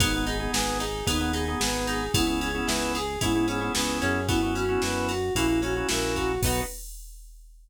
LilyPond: <<
  \new Staff \with { instrumentName = "Flute" } { \time 4/4 \key b \major \tempo 4 = 112 dis'8 gis'8 b'8 gis'8 dis'8 gis'8 b'8 gis'8 | e'8 gis'8 b'8 gis'8 e'8 gis'8 b'8 gis'8 | e'8 fis'8 b'8 fis'8 e'8 fis'8 ais'8 fis'8 | b'4 r2. | }
  \new Staff \with { instrumentName = "Drawbar Organ" } { \time 4/4 \key b \major <b dis' gis'>16 <b dis' gis'>8 <b dis' gis'>4~ <b dis' gis'>16 <b dis' gis'>16 <b dis' gis'>16 <b dis' gis'>16 <b dis' gis'>16 <b dis' gis'>4 | <b cis' e' gis'>16 <b cis' e' gis'>8 <b cis' e' gis'>4~ <b cis' e' gis'>16 <b cis' e' gis'>16 <b cis' e' gis'>16 <b cis' e' gis'>16 <b cis' e' gis'>16 <b cis' e' gis'>4 | <b cis' e' fis'>16 <b cis' e' fis'>8 <b cis' e' fis'>4~ <b cis' e' fis'>16 <ais cis' e' fis'>16 <ais cis' e' fis'>16 <ais cis' e' fis'>16 <ais cis' e' fis'>16 <ais cis' e' fis'>4 | <b dis' fis'>4 r2. | }
  \new Staff \with { instrumentName = "Acoustic Guitar (steel)" } { \time 4/4 \key b \major b8 dis'8 gis'8 dis'8 b8 dis'8 gis'8 dis'8 | b8 cis'8 e'8 gis'8 e'8 cis'8 b8 cis'8 | b8 cis'8 e'8 fis'8 ais8 cis'8 e'8 fis'8 | <b dis' fis'>4 r2. | }
  \new Staff \with { instrumentName = "Synth Bass 1" } { \clef bass \time 4/4 \key b \major gis,,4 gis,,4 dis,4 gis,,4 | cis,4 cis,4 gis,4 cis,8 fis,8~ | fis,4 fis,4 ais,,4 ais,,4 | b,,4 r2. | }
  \new DrumStaff \with { instrumentName = "Drums" } \drummode { \time 4/4 <bd cymr>8 cymr8 sn8 cymr8 <bd cymr>8 cymr8 sn8 cymr8 | <bd cymr>8 cymr8 sn8 cymr8 <bd cymr>8 cymr8 sn8 cymr8 | <bd cymr>8 cymr8 sn8 cymr8 <bd cymr>8 cymr8 sn8 <bd cymr>8 | <cymc bd>4 r4 r4 r4 | }
>>